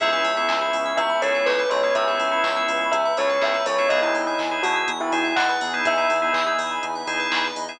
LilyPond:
<<
  \new Staff \with { instrumentName = "Tubular Bells" } { \time 4/4 \key cis \minor \tempo 4 = 123 e''2 e''8 cis''16 r16 b'8 cis''8 | e''2 e''8 cis''16 r16 e''8 cis''8 | dis''16 e'8 r8. fis'16 r8 e'16 e'16 r16 fis''16 r8. | e''4. r2 r8 | }
  \new Staff \with { instrumentName = "Drawbar Organ" } { \time 4/4 \key cis \minor <b cis' e' gis'>16 <b cis' e' gis'>8 <b cis' e' gis'>8 <b cis' e' gis'>4~ <b cis' e' gis'>16 <b cis' e' gis'>4~ <b cis' e' gis'>16 <b cis' e' gis'>16~ | <b cis' e' gis'>16 <b cis' e' gis'>8 <b cis' e' gis'>8 <b cis' e' gis'>4~ <b cis' e' gis'>16 <b cis' e' gis'>4~ <b cis' e' gis'>16 <b cis' e' gis'>16 | <b dis' e' gis'>16 <b dis' e' gis'>8 <b dis' e' gis'>8 <b dis' e' gis'>4~ <b dis' e' gis'>16 <b dis' e' gis'>4~ <b dis' e' gis'>16 <b dis' e' gis'>16~ | <b dis' e' gis'>16 <b dis' e' gis'>8 <b dis' e' gis'>8 <b dis' e' gis'>4~ <b dis' e' gis'>16 <b dis' e' gis'>4~ <b dis' e' gis'>16 <b dis' e' gis'>16 | }
  \new Staff \with { instrumentName = "Electric Piano 2" } { \time 4/4 \key cis \minor gis'16 b'16 cis''16 e''16 gis''16 b''16 cis'''16 e'''16 cis'''16 b''16 gis''16 e''16 cis''16 b'16 gis'16 b'16 | cis''16 e''16 gis''16 b''16 cis'''16 e'''16 cis'''16 b''16 gis''16 e''16 cis''16 b'16 gis'16 b'16 cis''16 e''16 | gis'16 b'16 dis''16 e''16 gis''16 b''16 dis'''16 e'''16 dis'''16 b''16 gis''16 e''16 dis''16 b'16 gis'16 b'16 | dis''16 e''16 gis''16 b''16 dis'''16 e'''16 dis'''16 b''16 gis''16 e''16 dis''16 b'16 gis'16 b'16 dis''16 e''16 | }
  \new Staff \with { instrumentName = "Synth Bass 1" } { \clef bass \time 4/4 \key cis \minor cis,8 cis,8 cis,8 cis,8 cis,8 cis,8 cis,8 cis,8 | cis,8 cis,8 cis,8 cis,8 cis,8 cis,8 cis,8 cis,8 | e,8 e,8 e,8 e,8 e,8 e,8 e,8 e,8 | e,8 e,8 e,8 e,8 e,8 e,8 e,8 e,8 | }
  \new Staff \with { instrumentName = "Pad 2 (warm)" } { \time 4/4 \key cis \minor <b cis' e' gis'>1 | <b cis' gis' b'>1 | <b dis' e' gis'>1 | <b dis' gis' b'>1 | }
  \new DrumStaff \with { instrumentName = "Drums" } \drummode { \time 4/4 <hh bd>8 hho8 <hc bd>8 hho8 <hh bd>8 hho8 <hc bd>8 hho8 | <hh bd>8 hho8 <hc bd>8 hho8 <hh bd>8 hho8 <hc bd>8 hho8 | <hh bd>8 hho8 <hc bd>8 hho8 <hh bd>8 hho8 <hc bd>8 hho8 | <hh bd>8 hho8 <hc bd>8 hho8 <hh bd>8 hho8 <hc bd>8 hho8 | }
>>